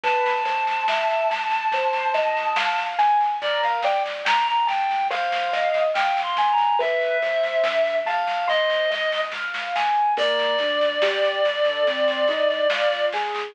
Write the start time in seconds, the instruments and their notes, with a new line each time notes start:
0.04 synth bass 1 G1, acoustic grand piano B4, clarinet A5, kick, snare
0.26 snare
0.45 synth bass 1 G1, acoustic grand piano C5, snare
0.67 snare
0.88 synth bass 1 G1, acoustic grand piano E5, snare
1.10 snare
1.30 synth bass 1 G1, acoustic grand piano A5, snare
1.51 synth bass 1 G1, snare
1.72 synth bass 1 G1, acoustic grand piano C5, kick, snare
1.93 snare
2.14 synth bass 1 C2, acoustic grand piano D#5, snare
2.37 snare
2.56 synth bass 1 G1, acoustic grand piano F5, snare
2.78 snare
2.99 synth bass 1 G1, acoustic grand piano G#5, snare
3.20 snare
3.41 acoustic grand piano A#4, clarinet D5, kick, snare
3.63 clarinet F5, snare
3.83 synth bass 1 G1, acoustic grand piano D5, clarinet G5, snare
4.06 snare
4.25 synth bass 1 G1, acoustic grand piano G5, clarinet A#5, snare
4.47 clarinet A#5, snare
4.67 synth bass 1 G1, clarinet G5, acoustic grand piano A5, snare
4.90 synth bass 1 D2, snare
5.10 synth bass 1 G1, acoustic grand piano C5, clarinet F5, kick, snare
5.32 snare
5.53 synth bass 1 G1, acoustic grand piano D#5, snare
5.74 snare
5.94 synth bass 1 G1, acoustic grand piano F5, clarinet G5, snare
6.17 snare
6.23 clarinet C6
6.37 synth bass 1 G1, acoustic grand piano G#5, snare
6.52 clarinet A#5
6.58 snare
6.79 acoustic grand piano B4, clarinet E5, kick, snare
7.01 snare
7.22 synth bass 1 G1, acoustic grand piano C5, snare
7.43 snare
7.64 synth bass 1 G2, acoustic grand piano E5, snare
7.86 snare
8.05 synth bass 1 E2, clarinet F5, acoustic grand piano A5, snare
8.27 synth bass 1 G1, snare
8.48 synth bass 1 G1, acoustic grand piano C5, clarinet D#5, kick, snare
8.70 snare
8.90 synth bass 1 G1, acoustic grand piano D#5, snare
9.12 snare
9.32 synth bass 1 A1, acoustic grand piano F5, kick, snare
9.54 snare
9.76 synth bass 1 G#1, acoustic grand piano G#5, snare
10.17 synth bass 1 G1, acoustic grand piano A#3, clarinet D5, kick, snare, crash
10.39 snare
10.58 synth bass 1 D2, acoustic grand piano D4, snare
10.81 snare
11.02 synth bass 1 D2, acoustic grand piano G4, snare
11.23 snare
11.44 synth bass 1 G1, acoustic grand piano A4, snare
11.65 synth bass 1 G2, snare
11.86 synth bass 1 G1, acoustic grand piano C4, kick, snare
12.08 snare
12.27 synth bass 1 C2, acoustic grand piano D#4, snare
12.50 snare
12.70 synth bass 1 G1, acoustic grand piano F4, snare
12.92 snare
13.12 synth bass 1 G1, acoustic grand piano G#4, snare
13.34 synth bass 1 G1, snare